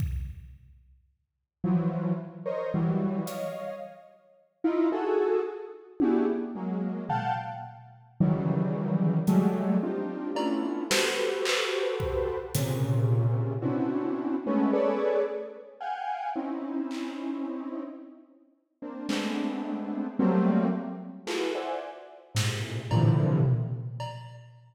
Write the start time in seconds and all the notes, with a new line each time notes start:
0.00 kick
1.64 E3 F3 F#3
2.46 A#4 C5 C#5 D#5
2.74 E3 F#3 G3
3.26 C#5 D#5 F5, closed hi-hat
4.64 D#4 E4 F4
4.92 F#4 G#4 A4
6.00 D4 E4 F#4 G4 G#4, high tom
6.55 F#3 G#3 A#3
7.09 F5 F#5 G5 A5, floor tom
8.20 C#3 D#3 E3 F#3 G3
9.27 F#3 G3 G#3 A3, closed hi-hat
9.83 C4 D4 D#4 F4 G4
10.35 A3 B3 C#4 D4 E4 F4, cowbell
10.90 F#4 G4 A4 B4 C5, snare
11.45 clap
12.00 kick
12.55 A#2 C3 C#3, closed hi-hat
13.62 B3 C4 C#4 D4 E4 F#4
14.46 G#3 A3 B3 C#4
14.73 G#4 A4 B4 C#5 D5
15.80 F5 F#5 G5 G#5
16.35 C4 C#4 D#4 E4
16.91 clap
18.82 A#3 C4 D4
19.09 G#3 A3 B3 C4 D4, clap
20.19 F#3 G3 A3 A#3 C4
21.27 E4 F4 F#4 G#4 A4 B4, clap
21.55 C5 D5 E5 F#5 G#5
22.35 G#2 A2 A#2 C3, snare
22.91 A2 A#2 C3 D3 E3 F3, cowbell
23.45 floor tom
24.00 cowbell